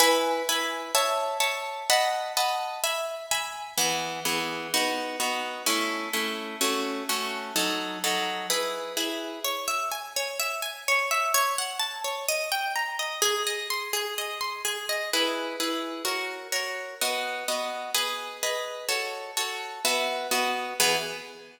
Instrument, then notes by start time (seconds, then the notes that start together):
orchestral harp
0.00 E4 B4 G#5
0.49 E4 B4 G#5
0.95 C#5 E5 A5
1.40 C#5 E5 A5
1.90 D#5 F#5 A5 B5
2.37 D#5 F#5 A5 B5
2.84 E5 G#5 B5
3.31 E5 G#5 B5
3.78 E3 B3 G#4
4.25 E3 B3 G#4
4.74 B3 D#4 F#4
5.20 B3 D#4 F#4
5.66 A3 C#4 E4
6.13 A3 C#4 E4
6.61 A3 C#4 F#4
7.09 A3 C#4 F#4
7.56 F#3 D#4 A4
8.04 F#3 D#4 A4
8.50 E4 G#4 B4
8.97 E4 G#4 B4
9.44 C#5
9.68 E5
9.92 G#5
10.16 C#5
10.40 E5
10.62 G#5
10.88 C#5
11.11 E5
11.34 C#5
11.58 F#5
11.80 A5
12.04 C#5
12.28 D#5
12.52 G5
12.76 A#5
12.99 D#5
13.22 G#4
13.47 D#5
13.70 C6
13.93 G#4
14.18 D#5
14.41 C6
14.65 G#4
14.89 D#5
15.13 E4 G#4 B4
15.60 E4 G#4 B4
16.05 F#4 A#4 C#5
16.52 F#4 A#4 C#5
17.01 B3 F#4 D#5
17.48 B3 F#4 D#5
17.94 G#4 B4 D#5
18.43 G#4 B4 D#5
18.89 F#4 A4 C#5
19.37 F#4 A4 C#5
19.85 B3 F#4 E5
20.31 B3 F#4 D#5
20.80 E3 B3 G#4